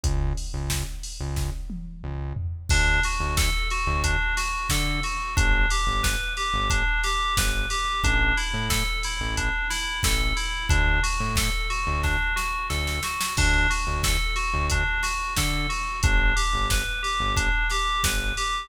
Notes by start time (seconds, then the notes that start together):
0.03 C#2, kick, closed hi-hat
0.37 open hi-hat
0.53 C#2
0.70 kick, snare
1.03 open hi-hat
1.20 C#2
1.36 kick, snare
1.70 high tom
2.03 C#2
2.36 floor tom
2.69 D2 D4, kick, crash
3.03 F#4, open hi-hat
3.20 D2
3.37 A4, kick, snare
3.70 F#4, open hi-hat
3.87 D2
4.04 D4, kick, closed hi-hat
4.37 F#4, snare, open hi-hat
4.69 D3 A4, kick, snare
5.03 F#4, open hi-hat
5.36 G1 D4, kick, closed hi-hat
5.70 G4, open hi-hat
5.87 G1
6.03 B4, kick, snare
6.37 G4, open hi-hat
6.54 G1
6.70 D4, kick, closed hi-hat
7.03 G4, snare, open hi-hat
7.37 G1 B4, kick, snare
7.70 G4, open hi-hat
8.03 A1 D4, kick, closed hi-hat
8.37 E4, open hi-hat
8.53 A2
8.70 A4, kick, snare
9.03 E4, open hi-hat
9.20 A1
9.37 D4, kick, closed hi-hat
9.70 E4, snare, open hi-hat
10.03 A1 A4, kick, snare
10.36 E4, open hi-hat
10.69 D2 D4, kick, closed hi-hat
11.03 F#4, open hi-hat
11.20 A2
11.36 A4, kick, snare
11.70 F#4, open hi-hat
11.87 D2
12.03 D4, kick, snare
12.36 F#4, snare
12.69 D2 A4, snare
12.87 snare
13.03 F#4, snare
13.21 snare
13.37 D2 D4, kick, crash
13.70 F#4, open hi-hat
13.87 D2
14.03 A4, kick, snare
14.36 F#4, open hi-hat
14.53 D2
14.70 D4, kick, closed hi-hat
15.03 F#4, snare, open hi-hat
15.36 D3 A4, kick, snare
15.69 F#4, open hi-hat
16.03 G1 D4, kick, closed hi-hat
16.36 G4, open hi-hat
16.53 G1
16.70 B4, kick, snare
17.03 G4, open hi-hat
17.20 G1
17.36 D4, kick, closed hi-hat
17.70 G4, snare, open hi-hat
18.03 G1 B4, kick, snare
18.37 G4, open hi-hat